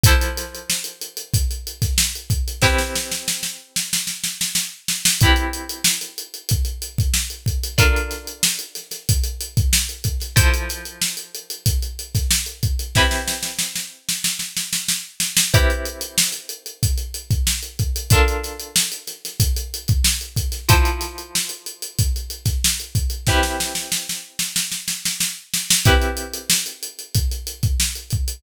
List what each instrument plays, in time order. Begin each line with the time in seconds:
0.03 acoustic guitar (steel) F3 E4 A4 C5, kick, closed hi-hat
0.21 closed hi-hat
0.37 snare, closed hi-hat
0.55 closed hi-hat
0.70 snare
0.84 closed hi-hat
1.01 closed hi-hat
1.17 closed hi-hat
1.34 kick, closed hi-hat
1.51 closed hi-hat
1.67 closed hi-hat
1.82 kick, snare, closed hi-hat
1.98 snare
2.15 closed hi-hat
2.30 kick, closed hi-hat
2.48 closed hi-hat
2.62 acoustic guitar (steel) C4 E4 G4 B4, kick, snare
2.78 snare
2.95 snare
3.12 snare
3.28 snare
3.43 snare
3.76 snare
3.93 snare
4.07 snare
4.24 snare
4.41 snare
4.55 snare
4.88 snare
5.05 snare
5.21 acoustic guitar (steel) C4 E4 G4 B4, kick, closed hi-hat
5.36 closed hi-hat
5.53 closed hi-hat
5.69 closed hi-hat
5.84 snare
6.01 snare, closed hi-hat
6.18 closed hi-hat
6.34 closed hi-hat
6.49 kick, closed hi-hat
6.65 closed hi-hat
6.82 closed hi-hat
6.98 kick, closed hi-hat
7.14 snare
7.30 closed hi-hat
7.46 kick, closed hi-hat
7.63 closed hi-hat
7.78 acoustic guitar (steel) D4 F4 A4 A#4, kick, closed hi-hat
7.96 closed hi-hat
8.11 snare, closed hi-hat
8.27 closed hi-hat
8.43 snare
8.59 closed hi-hat
8.75 snare, closed hi-hat
8.91 snare, closed hi-hat
9.09 kick, closed hi-hat
9.24 closed hi-hat
9.41 closed hi-hat
9.57 kick, closed hi-hat
9.73 snare
9.89 closed hi-hat
10.04 kick, closed hi-hat
10.20 snare, closed hi-hat
10.36 acoustic guitar (steel) F3 E4 A4 C5, kick, closed hi-hat
10.54 closed hi-hat
10.69 snare, closed hi-hat
10.85 closed hi-hat
11.01 snare
11.17 closed hi-hat
11.35 closed hi-hat
11.50 closed hi-hat
11.66 kick, closed hi-hat
11.82 closed hi-hat
11.99 closed hi-hat
12.15 kick, snare, closed hi-hat
12.31 snare
12.46 closed hi-hat
12.63 kick, closed hi-hat
12.79 closed hi-hat
12.95 acoustic guitar (steel) C4 E4 G4 B4, kick, snare
13.11 snare
13.28 snare
13.43 snare
13.59 snare
13.76 snare
14.09 snare
14.24 snare
14.39 snare
14.57 snare
14.73 snare
14.88 snare
15.20 snare
15.37 snare
15.54 acoustic guitar (steel) C4 E4 G4 B4, kick, closed hi-hat
15.70 closed hi-hat
15.85 closed hi-hat
16.01 closed hi-hat
16.18 snare
16.32 snare, closed hi-hat
16.49 closed hi-hat
16.66 closed hi-hat
16.83 kick, closed hi-hat
16.98 closed hi-hat
17.14 closed hi-hat
17.31 kick, closed hi-hat
17.47 snare
17.63 closed hi-hat
17.79 kick, closed hi-hat
17.96 closed hi-hat
18.10 acoustic guitar (steel) D4 F4 A4 A#4, kick, closed hi-hat
18.28 closed hi-hat
18.44 snare, closed hi-hat
18.60 closed hi-hat
18.76 snare
18.92 closed hi-hat
19.07 snare, closed hi-hat
19.25 snare, closed hi-hat
19.40 kick, closed hi-hat
19.56 closed hi-hat
19.74 closed hi-hat
19.88 kick, closed hi-hat
20.04 snare
20.21 closed hi-hat
20.36 kick, closed hi-hat
20.52 snare, closed hi-hat
20.69 acoustic guitar (steel) F3 E4 A4 C5, kick, closed hi-hat
20.85 closed hi-hat
21.01 snare, closed hi-hat
21.18 closed hi-hat
21.35 snare
21.49 closed hi-hat
21.66 closed hi-hat
21.82 closed hi-hat
21.99 kick, closed hi-hat
22.16 closed hi-hat
22.30 closed hi-hat
22.45 kick, snare, closed hi-hat
22.64 snare
22.80 closed hi-hat
22.95 kick, closed hi-hat
23.10 closed hi-hat
23.27 acoustic guitar (steel) C4 E4 G4 B4, kick, snare
23.43 snare
23.60 snare
23.75 snare
23.92 snare
24.09 snare
24.39 snare
24.56 snare
24.72 snare
24.88 snare
25.05 snare
25.20 snare
25.54 snare
25.70 snare
25.85 acoustic guitar (steel) C4 E4 G4 B4, kick, closed hi-hat
26.02 closed hi-hat
26.17 closed hi-hat
26.33 closed hi-hat
26.50 snare
26.66 snare, closed hi-hat
26.83 closed hi-hat
26.99 closed hi-hat
27.15 kick, closed hi-hat
27.31 closed hi-hat
27.47 closed hi-hat
27.63 kick, closed hi-hat
27.80 snare
27.95 closed hi-hat
28.10 kick, closed hi-hat
28.28 closed hi-hat